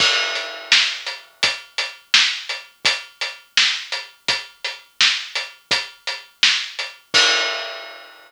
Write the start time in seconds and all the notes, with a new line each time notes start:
0.00 kick, crash
0.35 closed hi-hat
0.72 snare
1.07 closed hi-hat
1.43 kick, closed hi-hat
1.78 closed hi-hat
2.14 snare
2.49 closed hi-hat
2.85 kick, closed hi-hat
3.21 closed hi-hat
3.57 snare
3.92 closed hi-hat
4.28 kick, closed hi-hat
4.64 closed hi-hat
5.01 snare
5.35 closed hi-hat
5.71 kick, closed hi-hat
6.07 closed hi-hat
6.43 snare
6.79 closed hi-hat
7.14 kick, crash